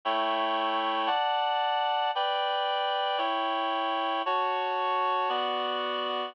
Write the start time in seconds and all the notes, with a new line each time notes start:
0.05 A3 E4 C#5 G5
1.07 D5 F#5 A5
2.15 B4 D5 G5
3.18 E4 C#5 G5
4.26 F#4 C#5 A5
5.29 B3 F#4 D5